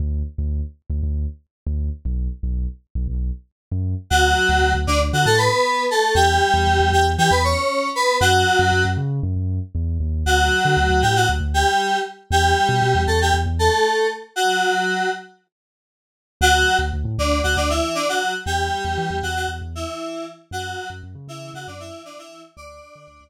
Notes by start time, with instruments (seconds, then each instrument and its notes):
0.00 synth bass 2 D2
0.38 synth bass 2 D2
0.90 synth bass 2 D2
1.03 synth bass 2 D2
1.66 synth bass 2 D2
2.05 synth bass 2 B1
2.43 synth bass 2 B1
2.95 synth bass 2 B1
3.08 synth bass 2 B1
3.72 synth bass 2 F#2
4.10 synth bass 2 D2, electric piano 2 F#3 F#4
4.49 synth bass 2 D2
4.62 synth bass 2 D2
4.74 synth bass 2 D2
4.87 synth bass 2 D2, electric piano 2 D3 D4
5.13 synth bass 2 D3, electric piano 2 F#3 F#4
5.26 synth bass 2 A2, electric piano 2 A3 A4
5.38 electric piano 2 B3 B4
5.91 electric piano 2 A3 A4
6.15 synth bass 2 E2, electric piano 2 G3 G4
6.54 synth bass 2 E2
6.67 synth bass 2 E2
6.80 synth bass 2 E2
6.92 synth bass 2 E2, electric piano 2 G3 G4
7.18 synth bass 2 E3, electric piano 2 G3 G4
7.30 synth bass 2 E2, electric piano 2 B3 B4
7.44 electric piano 2 C#4 C#5
7.96 electric piano 2 B3 B4
8.21 synth bass 2 F#2, electric piano 2 F#3 F#4
8.59 synth bass 2 F#2
8.72 synth bass 2 F#2
8.85 synth bass 2 F#2
8.97 synth bass 2 C#3
9.23 synth bass 2 F#2
9.36 synth bass 2 F#2
9.75 synth bass 2 E2
10.00 synth bass 2 D#2
10.26 synth bass 2 D2, electric piano 2 F#3 F#4
10.65 synth bass 2 D3
10.77 synth bass 2 D2
10.90 synth bass 2 D2
11.02 synth bass 2 A2, electric piano 2 G3 G4
11.16 electric piano 2 F#3 F#4
11.29 synth bass 2 D2
11.40 synth bass 2 D2
11.54 electric piano 2 G3 G4
12.30 synth bass 2 E2, electric piano 2 G3 G4
12.69 synth bass 2 B2
12.82 synth bass 2 B2
12.95 synth bass 2 E2
13.07 synth bass 2 E2, electric piano 2 A3 A4
13.21 electric piano 2 G3 G4
13.34 synth bass 2 E2
13.46 synth bass 2 E2
13.59 electric piano 2 A3 A4
14.36 electric piano 2 F#3 F#4
16.41 synth bass 2 D2, electric piano 2 F#3 F#4
16.79 synth bass 2 D2
16.93 synth bass 2 D2
17.04 synth bass 2 A2
17.18 synth bass 2 D2, electric piano 2 D3 D4
17.43 synth bass 2 D2, electric piano 2 F#3 F#4
17.56 synth bass 2 D2, electric piano 2 D3 D4
17.70 electric piano 2 E3 E4
17.95 electric piano 2 D3 D4
18.09 electric piano 2 F#3 F#4
18.46 synth bass 2 E2, electric piano 2 G3 G4
18.84 synth bass 2 E2
18.98 synth bass 2 E3
19.10 synth bass 2 E2
19.23 synth bass 2 E2, electric piano 2 F#3 F#4
19.36 electric piano 2 F#3 F#4
19.48 synth bass 2 E2
19.61 synth bass 2 E2
19.75 electric piano 2 E3 E4
20.51 synth bass 2 F#2, electric piano 2 F#3 F#4
20.90 synth bass 2 F#2
21.03 synth bass 2 F#2
21.15 synth bass 2 C#3
21.27 synth bass 2 C#3, electric piano 2 E3 E4
21.54 synth bass 2 C#3, electric piano 2 F#3 F#4
21.67 synth bass 2 F#2, electric piano 2 D3 D4
21.80 electric piano 2 E3 E4
22.05 electric piano 2 D3 D4
22.18 electric piano 2 E3 E4
22.57 synth bass 2 D2, electric piano 2 D4 D5
22.95 synth bass 2 D3
23.07 synth bass 2 D2
23.21 synth bass 2 D2